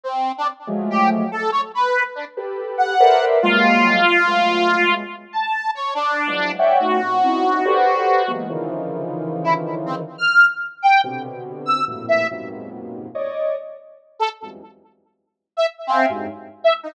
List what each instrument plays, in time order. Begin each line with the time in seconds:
0.04 lead 2 (sawtooth) C4
0.38 lead 2 (sawtooth) D4
0.67 lead 1 (square) F3 F#3 G#3 A3
0.90 lead 2 (sawtooth) G4
1.32 lead 2 (sawtooth) A4
1.52 lead 2 (sawtooth) C#5
1.75 lead 2 (sawtooth) B4
2.15 lead 2 (sawtooth) D4
2.37 lead 1 (square) G4 A4 B4
2.78 lead 2 (sawtooth) F#5
3.00 lead 1 (square) A4 A#4 B4 C5 D5 E5
3.42 lead 1 (square) F#3 G3 G#3 A#3, lead 2 (sawtooth) F4
4.27 lead 1 (square) F#3 G#3 A3 B3
5.33 lead 2 (sawtooth) A5
5.75 lead 2 (sawtooth) C#5
5.95 lead 2 (sawtooth) D4
6.27 lead 1 (square) E3 F3 F#3 G#3
6.59 lead 1 (square) C#5 D5 E5 F#5 G5
6.80 lead 1 (square) A3 B3 C#4 D#4 F4 F#4, lead 2 (sawtooth) F#4
7.02 lead 1 (square) A#2 C3 C#3
7.24 lead 1 (square) C4 C#4 D#4 E4
7.65 lead 1 (square) G4 A4 B4 C5 D5
8.27 lead 1 (square) E3 F#3 G#3 A#3 B3
8.49 lead 1 (square) C#3 D3 D#3 E3 F3
9.44 lead 2 (sawtooth) E4
9.86 lead 2 (sawtooth) C4
10.18 lead 2 (sawtooth) F6
10.82 lead 2 (sawtooth) G5
11.04 lead 1 (square) B2 C3 D3
11.66 lead 2 (sawtooth) E6
11.88 lead 1 (square) F2 G2 A2 A#2 B2
12.08 lead 2 (sawtooth) E5
12.31 lead 1 (square) F2 F#2 G#2 A#2 B2 C3
13.15 lead 1 (square) C#5 D5 D#5
14.19 lead 2 (sawtooth) A4
14.42 lead 1 (square) E2 F2 F#2 G2 G#2
15.57 lead 2 (sawtooth) E5
15.87 lead 2 (sawtooth) C4, lead 1 (square) E5 F5 G5 G#5
16.09 lead 1 (square) F#2 G2 G#2
16.64 lead 2 (sawtooth) E5
16.83 lead 2 (sawtooth) D#4